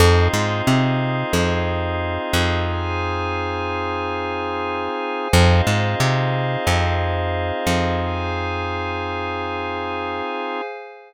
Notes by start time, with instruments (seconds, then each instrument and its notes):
0.00 electric bass (finger) F2, drawbar organ C4 D#4 F4 G#4, pad 5 (bowed) G#4 C5 D#5 F5
0.33 electric bass (finger) G#2
0.67 electric bass (finger) C3
1.33 electric bass (finger) F2
2.33 electric bass (finger) F2
2.68 pad 5 (bowed) G#4 C5 F5 G#5
5.33 electric bass (finger) F2, drawbar organ C4 D#4 F4 G#4, pad 5 (bowed) G#4 C5 D#5 F5
5.67 electric bass (finger) G#2
6.00 electric bass (finger) C3
6.67 electric bass (finger) F2
7.67 electric bass (finger) F2
7.99 pad 5 (bowed) G#4 C5 F5 G#5